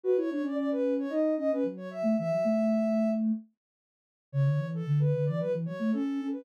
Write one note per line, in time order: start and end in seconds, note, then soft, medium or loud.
0.04 0.16 F#4 loud
0.04 0.16 B4 medium
0.16 0.29 E4 loud
0.16 0.30 C#5 medium
0.30 0.43 D4 loud
0.30 0.43 C#5 medium
0.42 1.06 C#4 medium
0.42 0.55 D5 medium
0.56 0.69 D5 medium
0.71 0.94 B4 medium
0.99 1.12 C#5 medium
1.09 1.35 D#4 loud
1.09 1.34 D#5 medium
1.37 1.50 C#4 medium
1.37 1.51 D#5 medium
1.52 1.65 C#4 loud
1.52 1.64 B4 medium
1.64 2.02 F#3 loud
1.77 1.90 C#5 medium
1.91 2.17 E5 medium
2.03 2.15 A3 loud
2.18 2.31 E3 loud
2.18 3.10 E5 medium
2.30 2.43 F#3 loud
2.44 3.31 A3 loud
4.32 4.45 C#3 loud
4.32 4.67 C#5 medium
4.45 4.58 D3 loud
4.57 4.82 E3 loud
4.74 5.00 A4 medium
4.86 4.99 D3 loud
4.99 5.12 D3 loud
4.99 5.24 B4 medium
5.15 5.27 D3 loud
5.25 5.41 E3 loud
5.25 5.38 D5 medium
5.40 5.54 F#3 loud
5.40 5.52 B4 medium
5.54 5.66 E3 loud
5.66 5.80 F#3 loud
5.66 5.91 C#5 medium
5.79 5.92 A3 loud
5.92 6.19 C#4 loud
5.92 6.27 A4 medium
6.21 6.45 C#4 medium
6.32 6.45 B4 medium